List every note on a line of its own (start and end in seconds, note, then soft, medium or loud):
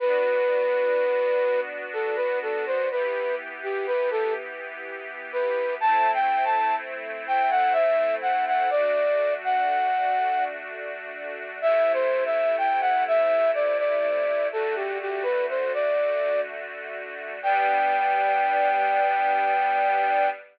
0.00 2.87 B3 medium
0.00 2.87 D4 medium
0.00 2.87 F#4 medium
0.00 1.60 B4 loud
1.93 2.16 A4 loud
2.16 2.39 B4 loud
2.42 2.65 A4 loud
2.66 2.89 C5 loud
2.90 5.78 E3 medium
2.90 5.78 B3 medium
2.90 5.78 G4 medium
2.90 3.35 B4 loud
3.63 3.86 G4 loud
3.87 4.10 B4 loud
4.11 4.34 A4 loud
5.32 5.75 B4 loud
5.80 8.68 A3 medium
5.80 8.68 C4 medium
5.80 8.68 E4 medium
5.80 6.11 A5 loud
6.14 6.45 G5 loud
6.45 6.75 A5 loud
7.27 7.50 G5 loud
7.50 7.73 F#5 loud
7.73 8.15 E5 loud
8.22 8.45 F#5 medium
8.47 8.70 F#5 loud
8.70 11.59 A3 medium
8.70 11.59 D4 medium
8.70 11.59 F#4 medium
8.70 9.34 D5 loud
9.44 10.44 F#5 loud
11.61 14.48 C3 medium
11.61 14.48 A3 medium
11.61 14.48 E4 medium
11.61 11.92 E5 loud
11.93 12.24 C5 loud
12.25 12.56 E5 loud
12.58 12.81 G5 medium
12.81 13.04 F#5 loud
13.07 13.51 E5 loud
13.54 13.77 D5 loud
13.79 14.48 D5 loud
14.52 17.39 D3 medium
14.52 17.39 A3 medium
14.52 17.39 F#4 medium
14.52 14.75 A4 loud
14.75 14.98 G4 loud
15.01 15.24 G4 loud
15.23 15.46 B4 loud
15.49 15.72 C5 medium
15.74 16.41 D5 loud
17.42 20.28 G3 loud
17.42 20.28 B3 loud
17.42 20.28 D4 medium
17.42 20.29 G5 loud